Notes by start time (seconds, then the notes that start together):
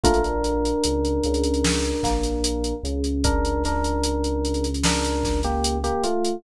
0.04 A#1 A3 A#3 D4 F4 A#4, kick, closed hi-hat
0.14 closed hi-hat
0.24 closed hi-hat
0.44 closed hi-hat
0.65 closed hi-hat
0.84 C#2 C#3, closed hi-hat
1.05 closed hi-hat
1.24 C#2 C#3, closed hi-hat
1.34 closed hi-hat
1.44 closed hi-hat
1.54 closed hi-hat
1.65 snare
1.85 closed hi-hat
2.03 A#1 A#3, kick, snare, closed hi-hat
2.24 closed hi-hat
2.44 closed hi-hat
2.64 closed hi-hat
2.83 C#2 C#3, closed hi-hat
3.04 closed hi-hat
3.24 D4 A#4, kick, closed hi-hat
3.45 closed hi-hat
3.64 D4 A#4, snare, closed hi-hat
3.84 closed hi-hat
4.04 closed hi-hat
4.24 closed hi-hat
4.45 closed hi-hat
4.54 closed hi-hat
4.64 closed hi-hat
4.74 closed hi-hat
4.83 D4 A#4, snare
5.04 closed hi-hat
5.24 kick, snare, closed hi-hat
5.43 A#3 G4, closed hi-hat
5.64 closed hi-hat
5.84 A#3 G4, closed hi-hat
6.04 A3 F4, closed hi-hat
6.25 closed hi-hat